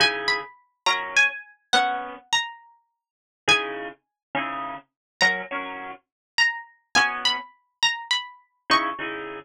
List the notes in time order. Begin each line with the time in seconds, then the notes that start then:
0.00 C#3 D#4 E4 G#4 G#5
0.28 B5
0.86 F#3 C#4 A#4 A#5
1.17 G#5
1.73 B3 C#4 F#4 F#5
2.33 A#5
3.48 C#3 D#4 E4 G#4 G#5
4.35 C#3 D#4 E4 G#4
5.21 F#3 C#4 A#4 A#5
5.51 F#3 C#4 A#4
6.38 A#5
6.95 B3 C#4 F#4 G#5
7.25 B5
7.83 A#5
8.11 B5
8.70 C#3 D#4 E4 G#4 C#6
8.99 C#3 D#4 E4 G#4